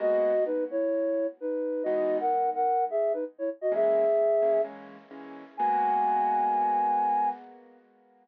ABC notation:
X:1
M:4/4
L:1/16
Q:1/4=129
K:G#m
V:1 name="Flute"
[Fd]4 [DB]2 [Ec]6 [DB]4 | [Fd]3 [Af]3 [Af]3 [Ge]2 [DB] z [Ec] z [Fd] | [Ge]8 z8 | g16 |]
V:2 name="Acoustic Grand Piano"
[G,A,B,F]16 | [E,G,B,D]16 | [E,G,A,C]6 [E,G,A,C]2 [E,G,A,C]4 [E,G,A,C]4 | [G,A,B,F]16 |]